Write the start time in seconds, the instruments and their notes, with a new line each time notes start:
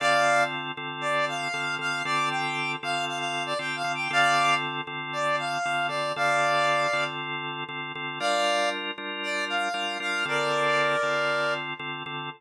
0.00 drawbar organ D3 C4 F4 A4, clarinet D5 F5
0.77 drawbar organ D3 C4 F4 A4
1.01 clarinet D5
1.28 clarinet F5
1.54 drawbar organ D3 C4 F4 A4
1.79 drawbar organ D3 C4 F4 A4, clarinet F5
2.05 drawbar organ D3 C4 F4 A4, clarinet D5
2.30 clarinet G5
2.83 drawbar organ D3 C4 F4 A4, clarinet F5
3.08 clarinet F5
3.19 clarinet F5
3.46 clarinet D5
3.59 drawbar organ D3 C4 F4 A4, clarinet G5
3.76 clarinet F5
3.84 drawbar organ D3 C4 F4 A4
3.95 clarinet G5
4.10 drawbar organ D3 C4 F4 A4, clarinet D5 F5
4.87 drawbar organ D3 C4 F4 A4
5.13 clarinet D5
5.39 clarinet F5
5.65 drawbar organ D3 C4 F4 A4
5.88 drawbar organ D3 C4 F4 A4, clarinet D5
6.16 drawbar organ D3 C4 F4 A4, clarinet D5 F5
6.93 drawbar organ D3 C4 F4 A4
7.69 drawbar organ D3 C4 F4 A4
7.95 drawbar organ D3 C4 F4 A4
8.20 drawbar organ G3 D4 F4 A#4, clarinet D5 F5
8.98 drawbar organ G3 D4 F4 A#4
9.23 clarinet D5
9.49 clarinet F5
9.74 drawbar organ G3 D4 F4 A#4
10.00 drawbar organ G3 D4 F4 A#4, clarinet F5
10.25 drawbar organ D3 C4 F4 A4, clarinet A#4 D5
11.03 drawbar organ D3 C4 F4 A4
11.79 drawbar organ D3 C4 F4 A4
12.06 drawbar organ D3 C4 F4 A4